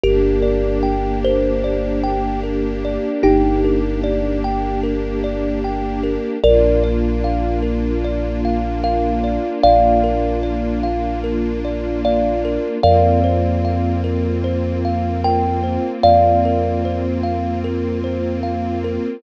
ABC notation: X:1
M:4/4
L:1/8
Q:1/4=75
K:Bb
V:1 name="Kalimba"
[GB]3 c3 z2 | [EG]3 z5 | [Bd]6 f2 | [df]6 d2 |
[df]6 g2 | [df]3 z5 |]
V:2 name="Kalimba"
B d g B d g B d | g B d g B d g B | B d f B d f B d | f B d f B d f B |
B c f B c f B c | f B c f B c f B |]
V:3 name="String Ensemble 1"
[B,DG]8- | [B,DG]8 | [B,DF]8- | [B,DF]8 |
[B,CF]8- | [B,CF]8 |]
V:4 name="Synth Bass 2" clef=bass
G,,,8 | G,,,8 | B,,,8 | B,,,8 |
F,,8 | F,,8 |]